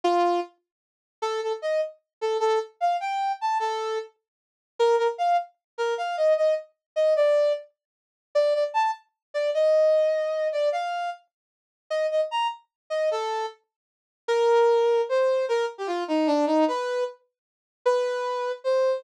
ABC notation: X:1
M:6/8
L:1/16
Q:3/8=101
K:Gm
V:1 name="Brass Section"
F4 z8 | A2 A z e2 z4 A2 | A2 z2 f2 g4 a2 | A4 z8 |
B2 B z f2 z4 B2 | f2 e2 e2 z4 e2 | d4 z8 | d2 d z a2 z4 d2 |
e10 d2 | f4 z8 | e2 e z b2 z4 e2 | A4 z8 |
[K:Cm] B8 c4 | B2 z G F2 E2 D2 E2 | =B4 z8 | =B8 c4 |]